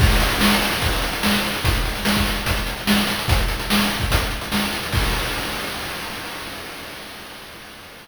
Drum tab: CC |x---------------|----------------|----------------|x---------------|
HH |-xxx-xxxxxxx-xxx|xxxx-xxxxxxx-xxx|xxxx-xxxxxxx-xxx|----------------|
SD |----o-------o---|----o-------o---|----o-------o---|----------------|
BD |o-------o-------|o----o--o-------|o------oo-------|o---------------|